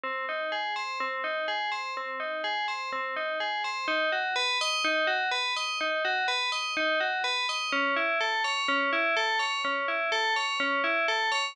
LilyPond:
\new Staff { \time 4/4 \key bes \major \tempo 4 = 125 c'8 ees'8 aes'8 c''8 c'8 ees'8 aes'8 c''8 | c'8 ees'8 aes'8 c''8 c'8 ees'8 aes'8 c''8 | \key b \major dis'8 fis'8 b'8 dis''8 dis'8 fis'8 b'8 dis''8 | dis'8 fis'8 b'8 dis''8 dis'8 fis'8 b'8 dis''8 |
cis'8 e'8 a'8 cis''8 cis'8 e'8 a'8 cis''8 | cis'8 e'8 a'8 cis''8 cis'8 e'8 a'8 cis''8 | }